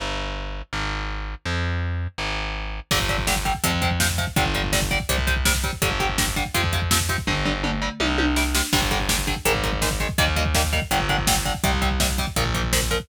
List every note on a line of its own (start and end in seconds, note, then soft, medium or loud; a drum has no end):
0.00 0.62 G1 medium
0.73 1.35 G#1 medium
1.45 2.07 F2 loud
2.18 2.80 G#1 medium
2.91 3.53 G1 loud
2.91 2.98 D3 loud
2.91 2.98 G3 medium
2.91 kick loud
2.91 crash loud
3.00 kick loud
3.09 3.17 D3 medium
3.09 3.17 G3 medium
3.09 kick medium
3.09 closed hi-hat medium
3.18 kick loud
3.27 3.34 D3 medium
3.27 3.34 G3 medium
3.27 kick medium
3.27 snare loud
3.36 kick medium
3.45 3.52 D3 medium
3.45 3.52 G3 medium
3.45 kick medium
3.45 closed hi-hat medium
3.55 kick medium
3.64 4.26 F2 loud
3.64 3.71 C3 loud
3.64 3.71 F3 medium
3.64 kick loud
3.64 closed hi-hat loud
3.73 kick medium
3.82 3.89 C3 medium
3.82 3.89 F3 medium
3.82 kick loud
3.82 closed hi-hat medium
3.91 kick medium
4.00 4.07 C3 medium
4.00 4.07 F3 medium
4.00 kick medium
4.00 snare loud
4.09 kick medium
4.18 4.25 C3 medium
4.18 4.25 F3 medium
4.18 kick medium
4.18 closed hi-hat medium
4.27 kick medium
4.36 4.98 G1 loud
4.36 4.44 D3 medium
4.36 4.44 G3 loud
4.36 kick loud
4.36 closed hi-hat loud
4.45 kick medium
4.55 4.62 D3 medium
4.55 4.62 G3 medium
4.55 kick medium
4.55 closed hi-hat medium
4.64 kick medium
4.73 4.80 D3 loud
4.73 4.80 G3 medium
4.73 kick loud
4.73 snare loud
4.82 kick loud
4.91 4.98 D3 medium
4.91 4.98 G3 medium
4.91 kick loud
4.91 closed hi-hat medium
5.00 kick loud
5.09 5.71 C2 loud
5.09 5.16 C3 loud
5.09 5.16 G3 medium
5.09 kick loud
5.09 closed hi-hat loud
5.18 kick medium
5.27 5.34 C3 medium
5.27 5.34 G3 medium
5.27 kick loud
5.27 closed hi-hat loud
5.36 kick medium
5.45 5.53 C3 medium
5.45 5.53 G3 medium
5.45 kick loud
5.45 snare loud
5.55 kick medium
5.64 5.71 C3 medium
5.64 5.71 G3 medium
5.64 kick loud
5.64 closed hi-hat medium
5.73 kick medium
5.82 6.44 G1 loud
5.82 5.89 D3 medium
5.82 5.89 G3 medium
5.82 kick loud
5.82 closed hi-hat loud
5.91 kick medium
6.00 6.07 D3 medium
6.00 6.07 G3 medium
6.00 kick medium
6.00 closed hi-hat medium
6.09 kick medium
6.18 6.25 D3 medium
6.18 6.25 G3 medium
6.18 kick loud
6.18 snare loud
6.27 kick medium
6.36 6.43 D3 medium
6.36 6.43 G3 medium
6.36 kick medium
6.36 closed hi-hat medium
6.45 kick medium
6.54 7.16 F2 medium
6.54 6.62 C3 medium
6.54 6.62 F3 medium
6.54 kick medium
6.54 closed hi-hat loud
6.64 kick loud
6.73 6.80 C3 medium
6.73 6.80 F3 medium
6.73 kick medium
6.73 closed hi-hat medium
6.82 kick medium
6.91 6.98 C3 medium
6.91 6.98 F3 medium
6.91 kick medium
6.91 snare loud
7.00 kick medium
7.09 7.16 C3 medium
7.09 7.16 F3 medium
7.09 kick medium
7.09 closed hi-hat medium
7.18 kick loud
7.27 7.89 G1 loud
7.27 7.34 D3 loud
7.27 7.34 G3 medium
7.27 kick loud
7.27 floor tom medium
7.45 7.53 D3 medium
7.45 7.53 G3 medium
7.45 floor tom medium
7.64 7.71 D3 medium
7.64 7.71 G3 medium
7.64 mid tom loud
7.82 7.89 D3 medium
7.82 7.89 G3 medium
8.00 8.62 C2 loud
8.00 8.07 C3 loud
8.00 8.07 G3 loud
8.00 high tom loud
8.18 8.25 C3 medium
8.18 8.25 G3 medium
8.18 high tom loud
8.36 8.43 C3 medium
8.36 8.43 G3 medium
8.36 snare loud
8.55 8.62 C3 medium
8.55 8.62 G3 medium
8.55 snare loud
8.73 9.35 G1 loud
8.73 8.80 D3 medium
8.73 8.80 G3 loud
8.73 kick loud
8.73 crash loud
8.82 kick medium
8.91 8.98 D3 medium
8.91 8.98 G3 medium
8.91 kick medium
8.91 closed hi-hat medium
9.00 kick medium
9.09 9.16 D3 medium
9.09 9.16 G3 medium
9.09 kick medium
9.09 snare loud
9.18 kick medium
9.27 9.34 D3 medium
9.27 9.34 G3 medium
9.27 kick medium
9.27 closed hi-hat medium
9.36 kick medium
9.45 10.07 G#1 loud
9.45 9.52 D#3 loud
9.45 9.52 G#3 loud
9.45 kick medium
9.45 closed hi-hat loud
9.55 kick loud
9.63 9.71 D#3 medium
9.63 9.71 G#3 medium
9.63 kick medium
9.63 closed hi-hat medium
9.73 kick loud
9.82 9.89 D#3 medium
9.82 9.89 G#3 medium
9.82 kick loud
9.82 snare loud
9.91 kick loud
10.00 10.07 D#3 medium
10.00 10.07 G#3 medium
10.00 kick medium
10.00 closed hi-hat medium
10.09 kick loud
10.18 10.80 D#2 loud
10.18 10.26 D#3 loud
10.18 10.26 G3 loud
10.18 10.26 A#3 medium
10.18 kick loud
10.18 closed hi-hat loud
10.27 kick medium
10.36 10.44 D#3 medium
10.36 10.44 G3 medium
10.36 10.44 A#3 medium
10.36 kick medium
10.36 closed hi-hat medium
10.45 kick loud
10.55 10.62 D#3 medium
10.55 10.62 G3 medium
10.55 10.62 A#3 medium
10.55 kick loud
10.55 snare loud
10.64 kick medium
10.73 10.80 D#3 medium
10.73 10.80 G3 medium
10.73 10.80 A#3 medium
10.73 kick medium
10.73 closed hi-hat medium
10.82 kick medium
10.91 11.53 G1 loud
10.91 10.98 D3 loud
10.91 10.98 G3 medium
10.91 kick loud
10.91 closed hi-hat loud
11.00 kick medium
11.09 11.16 D3 medium
11.09 11.16 G3 medium
11.09 kick medium
11.09 closed hi-hat medium
11.18 kick loud
11.27 11.35 D3 medium
11.27 11.35 G3 medium
11.27 kick loud
11.27 snare loud
11.36 kick medium
11.45 11.53 D3 medium
11.45 11.53 G3 medium
11.45 kick medium
11.45 closed hi-hat medium
11.55 kick medium
11.64 12.25 C2 loud
11.64 11.71 C3 loud
11.64 11.71 G3 loud
11.64 kick loud
11.64 closed hi-hat loud
11.73 kick medium
11.82 11.89 C3 medium
11.82 11.89 G3 medium
11.82 kick medium
11.82 closed hi-hat medium
11.91 kick medium
12.00 12.07 C3 medium
12.00 12.07 G3 medium
12.00 kick loud
12.00 snare loud
12.09 kick medium
12.18 12.26 C3 medium
12.18 12.26 G3 medium
12.18 kick medium
12.18 closed hi-hat medium
12.27 kick loud
12.36 12.98 A#1 loud
12.36 12.44 A#2 medium
12.36 12.44 F3 loud
12.36 kick loud
12.36 closed hi-hat loud
12.45 kick loud
12.54 12.62 A#2 medium
12.54 12.62 F3 medium
12.54 kick medium
12.54 closed hi-hat medium
12.64 kick medium
12.73 12.80 A#2 medium
12.73 12.80 F3 medium
12.73 kick medium
12.73 snare loud
12.82 kick medium
12.91 12.98 A#2 loud
12.91 12.98 F3 medium
12.91 kick medium
12.91 closed hi-hat medium
13.00 kick loud